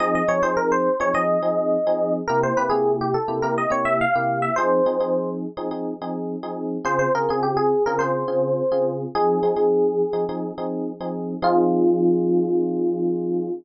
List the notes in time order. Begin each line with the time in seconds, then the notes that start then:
0.00 F3 C4 D#4 G#4 D#5
0.15 D#5
0.28 F3 C4 D#4 G#4 C#5
0.43 F3 C4 D#4 G#4 C5
0.57 A#4
0.72 C5
1.00 F3 C4 D#4 G#4 C#5
1.14 F3 C4 D#4 G#4 D#5
1.43 F3 C4 D#4 G#4
1.87 F3 C4 D#4 G#4
2.28 C3 A#3 E4 G4 A#4
2.43 C5
2.57 C3 A#3 E4 G4 B4
2.70 C3 A#3 E4 G4 G#4
3.01 G4
3.14 A4
3.28 C3 A#3 E4 G4
3.42 C3 A#3 E4 G4 A#4
3.58 D#5
3.70 C3 A#3 E4 G4 C#5
3.85 E5
4.01 F5
4.15 C3 A#3 E4 G4
4.42 E5
4.56 F3 C4 D#4 G#4 C5
4.86 F3 C4 D#4 G#4
5.00 F3 C4 D#4 G#4
5.57 F3 C4 D#4 G#4
5.71 F3 C4 D#4 G#4
6.02 F3 C4 D#4 G#4
6.43 F3 C4 D#4 G#4
6.85 C#3 C4 F4 G#4 C5
6.99 C5
7.15 C#3 C4 F4 G#4 A#4
7.29 C#3 C4 F4 G#4
7.43 G4
7.57 G#4
7.86 C#3 C4 F4 G#4 A#4
7.99 C#3 C4 F4 G#4 C5
8.28 C#3 C4 F4 G#4
8.72 C#3 C4 F4 G#4
9.15 F3 C4 D#4 G#4
9.43 F3 C4 D#4 G#4
9.56 F3 C4 D#4 G#4
10.13 F3 C4 D#4 G#4
10.29 F3 C4 D#4 G#4
10.58 F3 C4 D#4 G#4
11.00 F3 C4 D#4 G#4
11.42 F3 C4 D#4 F4 G#4